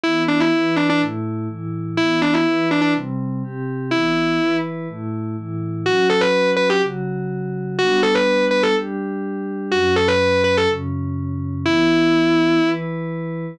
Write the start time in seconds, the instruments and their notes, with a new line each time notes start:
0.03 pad 5 (bowed) E3 B3 E4, distortion guitar E4
0.28 distortion guitar D4
0.40 distortion guitar E4
0.54 pad 5 (bowed) E3 E4 B4
0.76 distortion guitar D4
0.90 distortion guitar D4
1.00 pad 5 (bowed) A2 A3 E4
1.49 pad 5 (bowed) A2 E3 E4
1.97 pad 5 (bowed) E3 B3 E4, distortion guitar E4
2.22 distortion guitar D4
2.34 distortion guitar E4
2.46 pad 5 (bowed) E3 E4 B4
2.71 distortion guitar D4
2.81 distortion guitar D4
2.95 pad 5 (bowed) C3 G3 C4
3.43 pad 5 (bowed) C3 C4 G4
3.91 pad 5 (bowed) E3 B3 E4, distortion guitar E4
4.40 pad 5 (bowed) E3 E4 B4
4.88 pad 5 (bowed) A2 A3 E4
5.37 pad 5 (bowed) A2 E3 E4
5.85 pad 5 (bowed) F#3 C#4 F#4, distortion guitar F#4
6.10 distortion guitar A4
6.21 distortion guitar B4
6.56 distortion guitar B4
6.70 distortion guitar G4
6.81 pad 5 (bowed) C#3 F#3 F#4
7.79 pad 5 (bowed) G3 B3 D4, distortion guitar F#4
8.03 distortion guitar A4
8.15 distortion guitar B4
8.51 distortion guitar B4
8.63 distortion guitar A4
8.76 pad 5 (bowed) G3 D4 G4
9.71 pad 5 (bowed) F#2 F#3 C#4, distortion guitar F#4
9.96 distortion guitar A4
10.08 distortion guitar B4
10.44 distortion guitar B4
10.57 distortion guitar A4
10.69 pad 5 (bowed) F#2 C#3 C#4
11.64 pad 5 (bowed) E3 B3 E4, distortion guitar E4
12.64 pad 5 (bowed) E3 E4 B4